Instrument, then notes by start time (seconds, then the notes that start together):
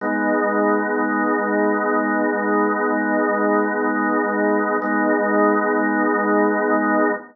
drawbar organ
0.01 G#3 B3 D#4
4.82 G#3 B3 D#4